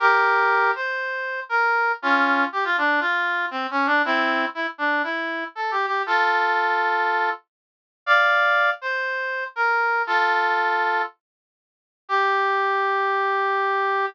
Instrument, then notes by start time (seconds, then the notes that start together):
brass section
0.00 G4 A#4
0.75 C5
1.49 A#4
2.02 C#4 F4
2.52 G4
2.65 F4
2.78 D4
3.00 F4
3.51 C4
3.71 C#4
3.86 D4
4.05 C4 E4
4.55 E4
4.78 D4
5.04 E4
5.55 A4
5.71 G4
5.86 G4
6.06 F4 A4
8.06 D5 F5
8.81 C5
9.56 A#4
10.07 F4 A4
12.09 G4